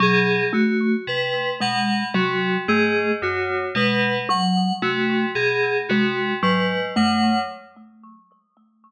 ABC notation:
X:1
M:7/8
L:1/8
Q:1/4=56
K:none
V:1 name="Tubular Bells" clef=bass
B,, z C, B,, C, ^G,, ^F,, | B,, z C, B,, C, ^G,, ^F,, |]
V:2 name="Kalimba"
^F, A, z ^G, F, A, z | ^G, ^F, A, z G, F, A, |]
V:3 name="Electric Piano 2"
^G ^F B ^f F G F | B ^f ^F ^G F B f |]